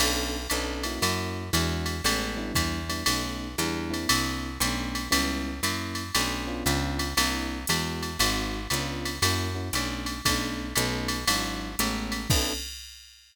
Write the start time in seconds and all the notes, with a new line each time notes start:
0.00 B1 B3 C#4 D4 A4, crash, ride
0.50 B1 B3 C#4 D4 A4, hi-hat pedal, ride
0.83 A#3 C#4 E4 F#4, ride
1.02 F#2, ride
1.53 E2 G#3 D4 E4 F#4, hi-hat pedal, ride
1.86 ride
2.04 A1 G#3 A3 B3 C#4, ride
2.37 G3 B3 D4 E4
2.55 E2, kick, hi-hat pedal, ride
2.89 G3 B3 D4 E4, ride
3.06 B1 A3 B3 C#4 D#4, ride
3.58 E2 G3 B3 D4 E4, hi-hat pedal, ride
3.90 A#3 C4 D4 E4, ride
4.09 C2, ride
4.60 B1 A3 B3 C#4 D4, hi-hat pedal, ride
4.95 ride
5.11 C#2 G3 B3 C#4 E4, ride
5.63 F#2 F#3 A#3 C#4 E4, hi-hat pedal, ride
5.95 ride
6.15 B1 A3 B3 C#4 D4, ride
6.47 B3 C#4 D4 F4
6.66 C#2, hi-hat pedal, ride
6.99 ride
7.17 C2 A#3 C4 D4 E4, ride
7.67 E2 G#3 B3 E4 F#4, hi-hat pedal, ride
8.03 ride
8.19 G#1 G#3 C4 D#4 F#4, ride
8.70 C#2 B3 C#4 D4 F4, hi-hat pedal, ride
9.05 ride
9.22 F#2 A#3 C#4 E4 F#4, ride
9.55 A#3 C#4 E4 F#4
9.73 B1 A3 B3 C#4 D4, hi-hat pedal, ride
10.06 ride
10.25 B1 A3 B3 C#4 D4, kick, ride
10.76 B1 A3 B3 C#4 D#4, hi-hat pedal, ride
11.08 ride
11.27 G#1 F#3 G#3 D4 E4, ride
11.79 A1 G#3 A3 B3 C#4, hi-hat pedal, ride
12.12 ride
12.30 B1 B3 C#4 D4 A4, kick, crash